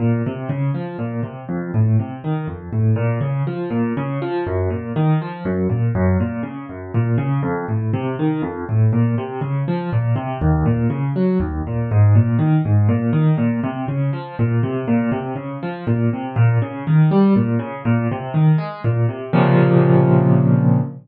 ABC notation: X:1
M:3/4
L:1/8
Q:1/4=121
K:Bbm
V:1 name="Acoustic Grand Piano" clef=bass
B,, C, D, F, B,, C, | F,, =A,, C, E, F,, A,, | B,, D, F, B,, D, F, | G,, B,, E, F, G,, B,, |
G,, B,, D, G,, B,, D, | F,, =A,, C, E, F,, A,, | B,, C, D, F, B,, C, | E,, B,, D, G, E,, B,, |
A,, B,, E, A,, B,, E, | B,, C, D, F, B,, C, | B,, C, D, F, B,, C, | B,, D, E, =G, B,, D, |
B,, C, E, A, B,, C, | [B,,C,D,F,]6 |]